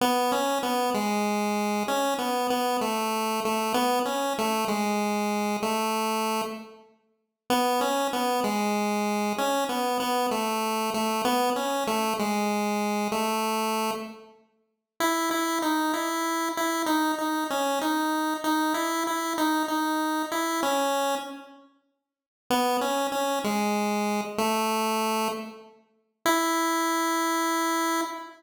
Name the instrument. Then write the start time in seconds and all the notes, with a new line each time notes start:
lead 1 (square)
0.01 B3
0.32 C#4
0.63 B3
0.94 G#3
1.88 C#4
2.18 B3
2.50 B3
2.81 A3
3.45 A3
3.74 B3
4.05 C#4
4.38 A3
4.68 G#3
5.62 A3
7.50 B3
7.81 C#4
8.13 B3
8.44 G#3
9.38 C#4
9.69 B3
10.00 B3
10.31 A3
10.94 A3
11.25 B3
11.56 C#4
11.87 A3
12.19 G#3
13.12 A3
15.00 E4
15.31 E4
15.62 D#4
15.93 E4
16.57 E4
16.86 D#4
17.18 D#4
17.50 C#4
17.81 D#4
18.44 D#4
18.74 E4
19.07 E4
19.38 D#4
19.68 D#4
20.32 E4
20.63 C#4
22.50 B3
22.81 C#4
23.12 C#4
23.44 G#3
24.38 A3
26.26 E4